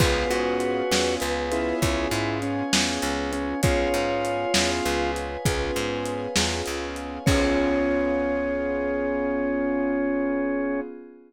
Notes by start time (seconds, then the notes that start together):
0.00 C#2 B3 C#4 F4 G#4 B4 C#5 F5 G#5, kick, crash
0.30 G#2 F#4, closed hi-hat
0.60 closed hi-hat
0.91 E2 B3 C#4 F4 G#4, snare
1.20 C#2 B4, closed hi-hat
1.52 B3 C#4 E4 F4 G#4, closed hi-hat
1.82 C#2 B4 C#5 F5 G#5, kick, closed hi-hat
2.11 G#2 E4, closed hi-hat
2.42 C#4, closed hi-hat
2.73 E2 B3 C#4 F4 G#4, snare
3.02 C#2, closed hi-hat
3.33 C#4, closed hi-hat
3.63 C#2 B3 C#4 F4 G#4 B4 C#5 F5 G#5, kick, closed hi-hat
3.94 G#2, closed hi-hat
4.25 closed hi-hat
4.54 E2 B3 C#4 F4 G#4, snare
4.85 C#2 B4, closed hi-hat
5.16 closed hi-hat
5.45 C#2 B3 C#4 F4 G#4 B4 C#5 F5 G#5, kick, closed hi-hat
5.76 G#2, closed hi-hat
6.06 closed hi-hat
6.36 E2 B3 C#4 F4 G#4, snare
6.66 C#2, closed hi-hat
6.96 closed hi-hat
7.26 C#2 B3 C#4 F4 G#4 C#5, kick, crash